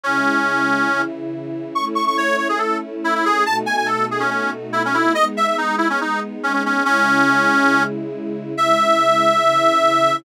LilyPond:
<<
  \new Staff \with { instrumentName = "Accordion" } { \time 4/4 \key e \major \tempo 4 = 141 cis'2~ cis'8 r4. | cis'''16 r16 cis'''16 cis'''16 cis''8 cis''16 gis'16 a'8 r8 e'16 e'16 gis'8 | a''16 r16 gis''16 gis''16 a'8 gis'16 cis'16 cis'8 r8 e'16 cis'16 e'8 | dis''16 r16 e''16 e''16 dis'8 e'16 cis'16 dis'8 r8 cis'16 cis'16 cis'8 |
cis'2~ cis'8 r4. | e''1 | }
  \new Staff \with { instrumentName = "String Ensemble 1" } { \time 4/4 \key e \major <cis gis e'>2 <cis e e'>2 | <a cis' e'>1 | <b, a dis' fis'>1 | <gis b dis'>1 |
<cis gis e'>1 | <cis gis e'>2 <cis e e'>2 | }
>>